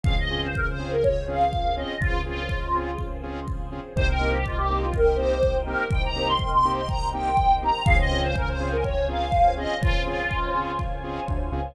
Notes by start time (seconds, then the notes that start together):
0.04 C#2 C4 C#4 F4 G#4 F5, kick
0.18 D#5
0.30 C4 C#4 F4 G#4
0.44 C5
0.55 A#4, kick
0.68 C5
0.79 C4 C#4 F4 G#4
0.92 A#4
1.03 C#5, kick
1.28 C4 C#4 F4 G#4 F5
1.53 kick
1.76 C4 C#4 F4 G#4 D#5
1.99 C#2 C4 C#4 F4 G#4 C5, kick
2.25 C4 C#4 F4 G#4
2.49 kick
2.74 C4 C#4 F4 G#4
2.98 kick
3.23 C4 C#4 F4 G#4
3.48 kick
3.72 C4 C#4 F4 G#4
3.95 C2 A#3 C4 D#4 G4 A#4 C5 D#5 G5, kick
4.08 A#4
4.20 A#3 C4 D#4 G4
4.33 G4
4.45 F4, kick
4.57 G4
4.69 A#3 C4 D#4 G4
4.82 F4
4.94 A#4, kick
5.16 A#3 C4 D#4 G4 C5
5.43 kick
5.65 A#3 C4 D#4 G4 A#4
5.91 C2 G5, kick
6.05 A#5
6.16 A#3 C4 D#4 G4
6.28 C6
6.38 C6, kick
6.53 C6
6.64 A#3 C4 D#4 G4
6.76 C6
6.89 A#5, kick
7.13 A#3 C4 D#4 G4 G5
7.37 kick
7.62 A#3 C4 D#4 G4 A#5
7.85 C#2 C4 C#4 F4 G#4 C5 C#5 F5 G#5, kick
7.99 D#5
8.11 C4 C#4 F4 G#4
8.23 C5
8.36 A#4, kick
8.48 C5
8.59 C4 C#4 F4 G#4
8.72 A#4
8.84 C#5, kick
9.08 C4 C#4 F4 G#4 F5
9.32 kick
9.57 C4 C#4 F4 G#4 D#5
9.81 C#2 F4, kick
10.05 C4 C#4 F4 G#4
10.31 kick
10.55 C4 C#4 F4 G#4
10.79 kick
11.03 C4 C#4 F4 G#4
11.28 D2, kick
11.52 C#2 C4 C#4 F4 G#4